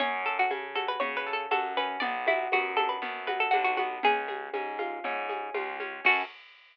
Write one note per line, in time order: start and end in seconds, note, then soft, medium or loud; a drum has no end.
0.00 0.45 F#2 medium
0.00 0.50 C#4 loud
0.00 0.21 C#5 loud
0.00 low conga medium
0.00 shaker medium
0.25 0.38 A4 medium
0.25 1.26 A4 medium
0.25 shaker medium
0.39 0.51 F#4 medium
0.50 0.96 C#3 medium
0.50 1.00 C#4 medium
0.50 high conga medium
0.50 shaker medium
0.75 1.51 F#4 medium
0.75 0.88 A4 medium
0.75 high conga medium
0.75 shaker medium
0.88 1.00 B4 medium
1.00 1.46 C#3 medium
1.00 1.76 C#4 loud
1.00 1.16 C#5 medium
1.00 low conga medium
1.00 shaker medium
1.17 1.33 B4 medium
1.26 1.98 A4 loud
1.26 shaker medium
1.33 1.49 A4 medium
1.51 1.97 F#2 medium
1.51 1.99 F#4 loud
1.51 1.75 A4 medium
1.51 high conga medium
1.51 shaker medium
1.76 2.01 C#4 medium
1.76 2.02 B4 medium
1.76 shaker medium
2.00 2.47 B1 loud
2.00 2.52 B3 loud
2.00 2.24 D5 loud
2.00 low conga medium
2.00 shaker medium
2.27 2.49 E4 medium
2.27 3.28 F#4 medium
2.27 high conga medium
2.27 shaker medium
2.52 2.98 F#2 medium
2.52 3.01 B3 medium
2.52 2.76 F#4 medium
2.52 high conga medium
2.52 shaker medium
2.77 3.53 D4 medium
2.77 2.89 A4 medium
2.77 high conga medium
2.77 shaker medium
2.89 3.01 B4 medium
3.02 3.47 F#2 medium
3.02 3.79 B3 loud
3.02 low conga medium
3.02 shaker medium
3.27 4.00 F#4 medium
3.27 3.39 B4 medium
3.27 high conga medium
3.27 shaker medium
3.40 3.52 A4 medium
3.51 3.99 B1 medium
3.51 4.01 D4 medium
3.51 3.63 F#4 medium
3.51 high conga medium
3.51 shaker medium
3.64 3.76 F#4 medium
3.77 4.03 B3 medium
3.77 4.00 F#4 medium
3.77 high conga medium
3.77 shaker medium
4.03 4.49 C#2 loud
4.03 4.53 C#4 loud
4.03 4.95 G#4 medium
4.03 low conga medium
4.03 shaker medium
4.28 5.29 G#4 medium
4.28 high conga medium
4.28 shaker medium
4.53 4.99 G#2 medium
4.53 5.05 C#4 medium
4.53 high conga medium
4.53 shaker medium
4.79 5.54 F4 medium
4.79 high conga medium
4.79 shaker medium
5.04 5.49 G#2 medium
5.04 5.80 C#4 medium
5.04 low conga medium
5.04 shaker medium
5.29 6.01 G#4 medium
5.29 high conga medium
5.29 shaker medium
5.54 6.00 C#2 medium
5.54 6.02 F4 medium
5.54 high conga medium
5.54 shaker medium
5.80 6.04 C#4 medium
5.80 high conga medium
5.80 shaker medium
6.05 6.23 F#2 loud
6.05 6.22 C#4 medium
6.05 6.22 F#4 loud
6.05 6.24 F#4 loud
6.05 6.22 A4 loud
6.05 kick loud
6.05 crash loud